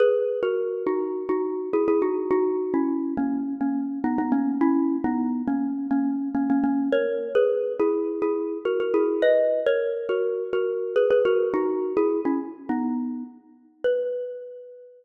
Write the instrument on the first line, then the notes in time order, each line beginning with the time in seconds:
xylophone
0.00 G#4 B4
0.43 F#4 A#4
0.87 D#4 F#4
1.29 D#4 F#4
1.73 E4 G#4
1.88 E4 G#4
2.02 D#4 F#4
2.31 D#4 F#4
2.74 C#4 E4
3.17 A#3 C#4
3.61 A#3 C#4
4.04 B3 D#4
4.18 B3 D#4
4.32 A#3 C#4
4.61 C#4 E4
5.04 B3 D#4
5.48 A#3 C#4
5.91 A#3 C#4
6.35 A#3 C#4
6.50 A#3 C#4
6.64 A#3 C#4
6.92 A#4 C#5
7.35 G#4 B4
7.80 E4 G#4
8.22 E4 G#4
8.65 F#4 A#4
8.80 F#4 A#4
8.94 E4 G#4
9.22 B4 D#5
9.66 A#4 C#5
10.09 F#4 A#4
10.53 F#4 A#4
10.96 G#4 B4
11.10 G#4 B4
11.25 F#4 A#4
11.54 D#4 F#4
11.97 E4 G#4
12.25 C#4 E4
12.69 B3 D#4
13.84 B4